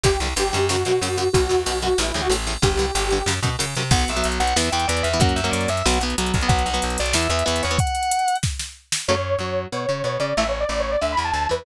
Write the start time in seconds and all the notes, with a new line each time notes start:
0.03 G1 G2 D3 G4, kick, ride
0.20 C2 G2 D3, ride
0.36 G1 G2 D3 G4, ride
0.53 F#2 G2 D3, ride
0.69 F#2 C#3 F#4, snare
0.85 F#2 B2 C#3, ride
1.01 F#2 C#3, ride
1.17 F#2 C#3, ride
1.33 B1 F#2 B2 F#4, kick, ride
1.49 E2 F#2 B2, ride
1.66 B1 F#2 B2, ride
1.82 F#2 B2 F#4, ride
1.98 A1 E2 A2 E4, snare
2.08 E4
2.14 D2 E2 A2, ride
2.22 F#4
2.30 A1 E2 A2, ride
2.47 E2 A2, ride
2.62 G1 G2 D3 G4, kick, ride
2.77 C2 G2 D3, ride
2.95 G1 G2 D3, ride
3.10 G2 D3, ride
3.26 F#2 C#3, snare
3.43 F#2 B2 C#3, kick, ride
3.59 F#2 C#3, ride
3.75 F#2 C3 C#3, ride
3.91 B1 F#3 B3 F#5, kick, crash
3.99 closed hi-hat
4.08 B1 E5, closed hi-hat
4.16 F#3 B3, closed hi-hat
4.24 B1, closed hi-hat
4.32 closed hi-hat
4.40 B1 F#5, closed hi-hat
4.47 closed hi-hat
4.56 E2 E3 B3 E5, snare
4.64 closed hi-hat
4.72 E2 E3 B3 G5, closed hi-hat
4.80 closed hi-hat
4.88 E2 E3 B3 D5, closed hi-hat
4.97 closed hi-hat
5.03 E2 E5, closed hi-hat
5.13 E3 B3, closed hi-hat
5.20 F#2 F#3 A#3 C#4 F#5, kick, closed hi-hat
5.29 closed hi-hat
5.36 F#2 E5, closed hi-hat
5.44 F#3 A#3 C#4, closed hi-hat
5.51 F#2 D5, closed hi-hat
5.61 closed hi-hat
5.68 F#2 E5, closed hi-hat
5.77 closed hi-hat
5.86 B1 F#3 B3 F#5, snare
5.94 closed hi-hat
6.01 B1 F#3 B3, closed hi-hat
6.10 closed hi-hat
6.18 B1 F#3 B3, closed hi-hat
6.26 closed hi-hat
6.34 B1, kick, closed hi-hat
6.41 F#3 B3, closed hi-hat
6.48 B1 F#3 B3 F#5, kick, closed hi-hat
6.59 closed hi-hat
6.66 B1 F#5, closed hi-hat
6.74 F#3 B3, closed hi-hat
6.82 B1, closed hi-hat
6.90 closed hi-hat
6.98 B1 D5, closed hi-hat
7.06 closed hi-hat
7.13 E2 E3 B3 E5, snare
7.23 closed hi-hat
7.30 E2 E3 B3 E5, closed hi-hat
7.39 closed hi-hat
7.45 E2 E3 B3 E5, closed hi-hat
7.56 closed hi-hat
7.63 E2 C#5, closed hi-hat
7.71 E3 B3, closed hi-hat
7.78 F#5, kick, closed hi-hat
7.87 closed hi-hat
7.95 closed hi-hat
8.03 closed hi-hat
8.11 closed hi-hat
8.19 closed hi-hat
8.28 closed hi-hat
8.35 closed hi-hat
8.43 kick, snare
8.59 snare
8.92 snare
9.08 F#2 C#3 F#3 A3 C#5
9.39 F#2 F#3
9.72 B2 B3 C#5
9.89 C#3 C#4
10.04 B2 B3 C#5
10.20 C#3 C#4 D5
10.37 A1 E3 A3 E5
10.49 C#5
10.61 D5
10.69 A1 A2 D5
10.80 C#5
10.91 D5
11.01 D2 D3 E5
11.12 B5
11.17 E2 E3
11.24 A5
11.33 D2 D3 A5
11.49 E2 E3 B4